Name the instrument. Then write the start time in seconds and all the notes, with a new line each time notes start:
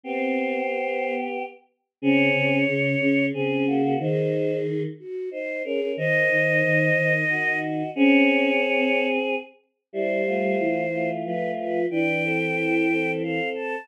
choir aahs
0.04 B3 C4 G4 C5
0.87 B3
2.02 C#3 C4 G#4 C#5
2.35 C#3
2.67 C#3
3.01 C#3
3.34 C#3 C4 G#4
3.67 A#3 F#4
3.83 A#3 F#4
4.00 D#3 D#4 G#4 C5
4.99 F#4
5.31 D#4 C5
5.64 C#4 G#4 A#4
5.80 C#4 A#4
5.97 D#3 D#4 C5 D#5
6.30 D#3
6.64 D#3
6.96 D#3
7.29 D#3 F#4 D#5
7.95 C4 C#4 G#4 C#5
8.77 C4
9.93 G3 E4 C5
10.26 A3 F4
10.59 E3
10.92 A3 F4
11.25 F3 A3 F4 B4
11.59 B4
11.91 E3 D4 B4 G5
12.24 C4 A4
12.90 C4 A4
13.22 C4 A4 F5
13.55 A5